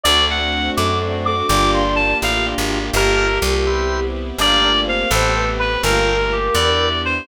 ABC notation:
X:1
M:6/8
L:1/16
Q:3/8=83
K:Gdor
V:1 name="Clarinet"
d2 ^f4 d'2 z2 d'2 | d'2 c'2 a2 f2 z4 | B2 B2 z8 | d4 f2 A4 =B2 |
B4 G2 d4 c2 |]
V:2 name="Choir Aahs"
A2 z4 A4 A2 | D6 z6 | G10 z2 | D2 D2 C2 c2 =B4 |
B10 z2 |]
V:3 name="Drawbar Organ"
[A,CD^F]8 [A,CDF]4 | [B,DFG]8 [B,DFG]4 | [Bfga]6 [=Bceg]6 | [ABfg]6 [A=Bcg]6 |
[ABfg]6 [=Bdeg]6 |]
V:4 name="Electric Bass (finger)" clef=bass
D,,6 ^F,,6 | G,,,6 A,,,3 _A,,,3 | G,,,4 C,,8 | G,,,6 A,,,6 |
G,,,6 E,,6 |]
V:5 name="String Ensemble 1"
[A,CD^F]12 | [B,DFG]12 | [B,FGA]6 [=B,CEG]6 | [A,B,FG]6 [A,=B,CG]6 |
[A,B,FG]6 [=B,DEG]6 |]